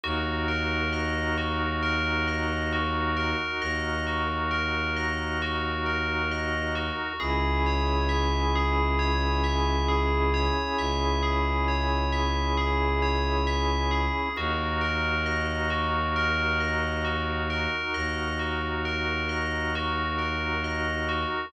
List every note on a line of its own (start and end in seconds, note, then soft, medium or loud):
0.04 3.34 D#2 loud
0.04 7.13 D#4 medium
0.04 7.13 F#4 medium
0.04 0.44 F#4 loud
0.04 7.13 A#4 medium
0.48 0.88 A#4 medium
0.93 1.33 D#5 medium
1.38 1.78 F#4 medium
1.83 2.23 A#4 medium
2.28 2.68 D#5 medium
2.73 3.13 F#4 medium
3.17 3.57 A#4 medium
3.62 6.91 D#2 loud
3.62 4.02 D#5 medium
4.07 4.47 F#4 medium
4.51 4.91 A#4 medium
4.96 5.37 D#5 medium
5.42 5.82 F#4 loud
5.86 6.26 A#4 medium
6.32 6.72 D#5 medium
6.75 7.16 F#4 medium
7.20 10.50 C#2 loud
7.20 14.29 C#4 medium
7.20 14.29 E4 medium
7.20 7.60 G#4 loud
7.20 14.29 G#4 medium
7.66 8.07 C#5 medium
8.09 8.49 E5 medium
8.56 8.96 G#4 medium
8.99 9.39 C#5 medium
9.44 9.84 E5 medium
9.88 10.29 G#4 medium
10.34 10.74 C#5 medium
10.79 14.08 C#2 medium
10.79 11.19 E5 medium
11.23 11.63 G#4 medium
11.68 12.08 C#5 medium
12.12 12.53 E5 medium
12.57 12.98 G#4 medium
13.02 13.43 C#5 medium
13.47 13.87 E5 medium
13.91 14.32 G#4 medium
14.36 17.67 D#2 loud
14.36 21.46 D#4 medium
14.36 21.46 F#4 medium
14.36 14.78 F#4 loud
14.36 21.46 A#4 medium
14.81 15.21 A#4 medium
15.26 15.66 D#5 medium
15.70 16.11 F#4 medium
16.16 16.56 A#4 medium
16.60 17.01 D#5 medium
17.05 17.45 F#4 medium
17.50 17.90 A#4 medium
17.94 21.25 D#2 loud
17.94 18.35 D#5 medium
18.39 18.80 F#4 medium
18.85 19.26 A#4 medium
19.29 19.69 D#5 medium
19.75 20.16 F#4 loud
20.18 20.59 A#4 medium
20.64 21.04 D#5 medium
21.09 21.49 F#4 medium